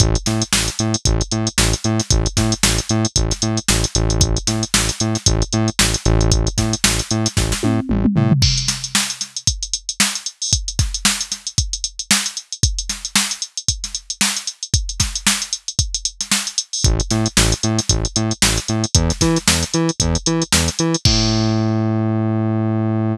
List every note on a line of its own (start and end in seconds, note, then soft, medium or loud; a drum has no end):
0.00 0.17 A1 loud
0.00 kick medium
0.00 closed hi-hat medium
0.15 closed hi-hat medium
0.26 0.43 A2 medium
0.26 snare soft
0.26 closed hi-hat medium
0.42 closed hi-hat medium
0.53 0.70 A1 medium
0.53 snare loud
0.68 closed hi-hat medium
0.79 0.96 A2 medium
0.79 closed hi-hat medium
0.94 closed hi-hat medium
1.05 1.22 A1 loud
1.05 kick medium
1.05 closed hi-hat medium
1.21 closed hi-hat medium
1.31 1.49 A2 medium
1.31 closed hi-hat medium
1.47 closed hi-hat medium
1.58 1.75 A1 loud
1.58 snare medium
1.73 closed hi-hat medium
1.84 2.01 A2 medium
1.84 closed hi-hat medium
2.00 snare soft
2.00 closed hi-hat medium
2.10 2.28 A1 medium
2.10 kick medium
2.10 closed hi-hat medium
2.26 closed hi-hat medium
2.37 2.54 A2 medium
2.37 kick medium
2.37 snare medium
2.37 closed hi-hat medium
2.52 closed hi-hat medium
2.63 2.80 A1 medium
2.63 snare medium
2.78 closed hi-hat medium
2.89 3.06 A2 medium
2.89 closed hi-hat medium
3.05 closed hi-hat medium
3.16 3.33 A1 medium
3.16 kick medium
3.16 closed hi-hat medium
3.31 snare soft
3.31 closed hi-hat medium
3.42 3.59 A2 medium
3.42 closed hi-hat medium
3.57 closed hi-hat medium
3.68 3.86 A1 medium
3.68 snare medium
3.84 closed hi-hat medium
3.95 4.38 A1 loud
3.95 closed hi-hat medium
4.10 closed hi-hat medium
4.21 kick medium
4.21 closed hi-hat medium
4.37 closed hi-hat medium
4.47 4.64 A2 medium
4.47 snare soft
4.47 closed hi-hat medium
4.63 closed hi-hat medium
4.74 4.91 A1 medium
4.74 snare loud
4.89 snare soft
4.89 closed hi-hat medium
5.00 5.17 A2 medium
5.00 closed hi-hat medium
5.15 snare soft
5.15 closed hi-hat medium
5.26 5.43 A1 loud
5.26 kick medium
5.26 closed hi-hat medium
5.42 closed hi-hat medium
5.53 5.70 A2 medium
5.53 closed hi-hat medium
5.68 closed hi-hat soft
5.79 5.96 A1 medium
5.79 snare medium
5.94 closed hi-hat medium
6.05 6.49 A1 loud
6.05 closed hi-hat medium
6.21 closed hi-hat medium
6.31 kick medium
6.31 closed hi-hat medium
6.47 closed hi-hat medium
6.58 6.75 A2 medium
6.58 kick medium
6.58 snare soft
6.58 closed hi-hat medium
6.73 closed hi-hat medium
6.84 7.01 A1 medium
6.84 snare loud
6.99 closed hi-hat medium
7.11 7.28 A2 medium
7.11 closed hi-hat medium
7.26 snare soft
7.26 closed hi-hat medium
7.37 7.54 A1 medium
7.37 kick medium
7.37 snare medium
7.52 snare medium
7.63 7.80 A2 medium
7.63 high tom medium
7.89 8.07 A1 medium
7.89 mid tom medium
8.05 mid tom medium
8.16 8.33 A2 medium
8.16 floor tom medium
8.31 floor tom medium
8.42 kick medium
8.42 crash medium
8.58 closed hi-hat medium
8.68 snare medium
8.68 closed hi-hat medium
8.84 closed hi-hat medium
8.95 snare medium
9.10 closed hi-hat medium
9.21 snare soft
9.21 closed hi-hat medium
9.37 closed hi-hat medium
9.47 kick medium
9.47 closed hi-hat medium
9.63 closed hi-hat medium
9.73 closed hi-hat medium
9.89 closed hi-hat medium
10.00 snare medium
10.15 closed hi-hat medium
10.26 closed hi-hat medium
10.42 open hi-hat medium
10.53 kick medium
10.53 closed hi-hat medium
10.68 closed hi-hat medium
10.79 kick medium
10.79 snare soft
10.79 closed hi-hat medium
10.94 closed hi-hat medium
11.05 snare medium
11.21 closed hi-hat medium
11.32 snare soft
11.32 closed hi-hat medium
11.47 closed hi-hat medium
11.58 kick medium
11.58 closed hi-hat medium
11.73 closed hi-hat medium
11.84 closed hi-hat medium
11.99 closed hi-hat medium
12.11 snare medium
12.26 closed hi-hat medium
12.37 closed hi-hat medium
12.52 closed hi-hat medium
12.63 kick medium
12.63 closed hi-hat medium
12.79 closed hi-hat medium
12.89 snare soft
12.89 closed hi-hat medium
13.05 closed hi-hat medium
13.16 snare medium
13.31 closed hi-hat medium
13.42 closed hi-hat medium
13.57 closed hi-hat medium
13.68 kick medium
13.68 closed hi-hat medium
13.84 snare soft
13.84 closed hi-hat medium
13.95 closed hi-hat medium
14.10 closed hi-hat medium
14.21 snare loud
14.37 closed hi-hat medium
14.47 closed hi-hat medium
14.63 closed hi-hat medium
14.74 kick medium
14.74 closed hi-hat medium
14.89 closed hi-hat medium
15.00 kick medium
15.00 snare medium
15.00 closed hi-hat medium
15.16 closed hi-hat medium
15.27 snare medium
15.42 closed hi-hat medium
15.53 closed hi-hat medium
15.68 closed hi-hat medium
15.79 kick medium
15.79 closed hi-hat medium
15.94 closed hi-hat medium
16.05 closed hi-hat medium
16.21 snare soft
16.21 closed hi-hat medium
16.31 snare medium
16.47 closed hi-hat medium
16.58 closed hi-hat medium
16.73 open hi-hat medium
16.84 17.01 A1 medium
16.84 kick loud
16.84 closed hi-hat medium
17.00 closed hi-hat medium
17.11 17.28 A2 medium
17.11 snare soft
17.11 closed hi-hat medium
17.26 closed hi-hat medium
17.37 17.54 A1 loud
17.37 snare medium
17.52 closed hi-hat medium
17.63 17.80 A2 medium
17.63 closed hi-hat medium
17.79 snare soft
17.79 closed hi-hat medium
17.89 18.07 A1 medium
17.89 kick medium
17.89 closed hi-hat medium
18.05 closed hi-hat medium
18.16 18.33 A2 medium
18.16 closed hi-hat medium
18.31 closed hi-hat medium
18.42 18.59 A1 medium
18.42 snare loud
18.58 closed hi-hat medium
18.68 18.86 A2 medium
18.68 closed hi-hat medium
18.84 closed hi-hat medium
18.95 19.12 E2 loud
18.95 kick medium
18.95 closed hi-hat medium
19.10 snare soft
19.10 closed hi-hat medium
19.21 19.38 E3 loud
19.21 kick medium
19.21 snare soft
19.21 closed hi-hat medium
19.36 snare soft
19.36 closed hi-hat medium
19.48 19.64 E2 medium
19.48 snare medium
19.63 closed hi-hat medium
19.74 19.91 E3 medium
19.74 closed hi-hat medium
19.89 closed hi-hat medium
20.00 20.17 E2 loud
20.00 kick medium
20.00 closed hi-hat medium
20.15 closed hi-hat medium
20.26 20.43 E3 medium
20.26 closed hi-hat medium
20.42 closed hi-hat medium
20.52 20.70 E2 medium
20.52 snare medium
20.68 snare soft
20.68 closed hi-hat medium
20.79 20.96 E3 medium
20.79 closed hi-hat medium
20.95 closed hi-hat medium
21.05 23.16 A2 loud
21.05 kick loud
21.05 crash loud